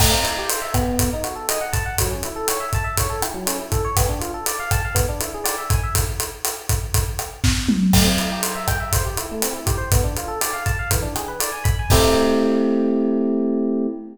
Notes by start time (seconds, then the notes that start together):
0.00 A3, kick, cross-stick, crash
0.11 C4
0.24 E4, closed hi-hat
0.38 G4
0.49 C5, closed hi-hat
0.62 E5
0.74 B3, kick, cross-stick, closed hi-hat
0.99 kick, closed hi-hat
1.13 D#4
1.24 F#4, closed hi-hat
1.36 A4
1.49 D#5, cross-stick, closed hi-hat
1.61 F#5
1.73 A5, kick, closed hi-hat
1.86 F#5
1.98 F#3, kick, closed hi-hat
2.10 C#4
2.23 E4, closed hi-hat
2.36 A4
2.48 C#5, cross-stick, closed hi-hat
2.60 E5
2.73 A5, kick, closed hi-hat
2.84 E5
2.97 C#5, kick, closed hi-hat
3.10 A4
3.22 E4, cross-stick, closed hi-hat
3.34 F#3
3.46 C#4, closed hi-hat
3.59 E4
3.72 A4, kick, closed hi-hat
3.85 C#5
3.97 B3, kick, cross-stick, closed hi-hat
4.09 D4
4.21 F4, closed hi-hat
4.34 A4
4.46 D5, closed hi-hat
4.60 F5
4.71 A5, kick, cross-stick, closed hi-hat
4.85 F5
4.95 B3, kick, closed hi-hat
5.09 D4
5.21 E4, closed hi-hat
5.34 G#4
5.44 D5, cross-stick, closed hi-hat
5.58 E5
5.70 G#5, kick, closed hi-hat
5.83 E5
5.95 kick, closed hi-hat
6.20 closed hi-hat
6.45 cross-stick, closed hi-hat
6.69 kick, closed hi-hat
6.94 kick, closed hi-hat
7.19 cross-stick, closed hi-hat
7.44 kick, snare
7.69 mid tom
7.93 A3, kick, cross-stick, crash
8.05 C4
8.18 E4, closed hi-hat
8.32 G4
8.43 C5, closed hi-hat
8.55 E5
8.68 G5, kick, cross-stick, closed hi-hat
8.80 E5
8.93 C5, kick, closed hi-hat
9.05 G4
9.17 E4, closed hi-hat
9.31 A3
9.42 C4, cross-stick, closed hi-hat
9.53 E4
9.66 G4, kick, closed hi-hat
9.78 C5
9.92 B3, kick, closed hi-hat
10.04 D4
10.17 F4, closed hi-hat
10.28 A4
10.41 D5, cross-stick, closed hi-hat
10.53 F5
10.66 A5, kick, closed hi-hat
10.79 F5
10.91 E3, kick, closed hi-hat
11.02 D4
11.16 G#4, cross-stick, closed hi-hat
11.28 B4
11.40 D5, closed hi-hat
11.52 G#5
11.64 B5, kick, closed hi-hat
11.79 G#5
11.90 A3 C4 E4 G4, kick, crash